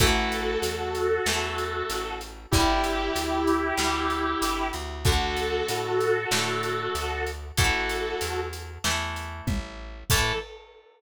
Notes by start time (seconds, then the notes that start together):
0.00 A1 E3 A3 F#4 A4, kick, closed hi-hat
0.32 closed hi-hat
0.62 E2, closed hi-hat
0.95 closed hi-hat
1.26 E2 E3 A3, snare
1.58 closed hi-hat
1.90 A1, closed hi-hat
2.21 closed hi-hat
2.51 G1 D3 G3 E4 G4, kick, closed hi-hat
2.84 closed hi-hat
3.15 D2, closed hi-hat
3.47 closed hi-hat
3.77 D2 D3 G3, snare
4.10 closed hi-hat
4.42 G1, closed hi-hat
4.73 D2, closed hi-hat
5.05 D3 A3 F#4 A4, kick, closed hi-hat
5.37 closed hi-hat
5.68 A2, closed hi-hat
6.01 closed hi-hat
6.31 A2 D3 A3, snare
6.63 closed hi-hat
6.95 D2, closed hi-hat
7.27 closed hi-hat
7.57 A1 E3 A3 F#4 A4, kick, closed hi-hat
7.89 closed hi-hat
8.21 E2, closed hi-hat
8.53 closed hi-hat
8.84 E2 E3 A3, snare
9.16 closed hi-hat
9.47 A1, kick, high tom
10.10 A2 E3 A3 A4, kick, crash